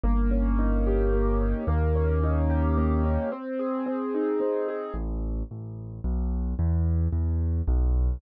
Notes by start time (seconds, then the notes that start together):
0.04 G1 A#3
0.31 C#4
0.59 D#4
0.87 G4
1.13 A#3
1.41 C#4
1.67 D#2 A#3
1.95 C#4
2.24 D#4
2.50 G4
2.78 A#3
3.04 C#4
3.32 C4
3.59 G#4
3.86 C4
4.15 D#4
4.40 C4
4.68 G#4
4.94 A1
5.51 A1
6.04 B1
6.59 E2
7.13 E2
7.68 B1